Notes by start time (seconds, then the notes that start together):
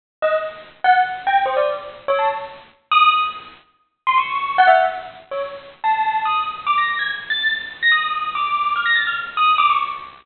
0.22 D#5
0.84 F#5
1.27 G5
1.46 C5
1.57 D5
2.08 C#5
2.19 A5
2.91 D#6
4.07 C6
4.18 C#6
4.58 F#5
4.67 E5
5.31 C#5
5.84 A5
6.25 D#6
6.67 D6
6.78 A#6
6.89 A#6
6.99 G#6
7.30 A6
7.83 A#6
7.92 D#6
8.35 D6
8.76 F6
8.86 A#6
8.95 A6
9.07 F6
9.37 D#6
9.58 D6
9.70 C#6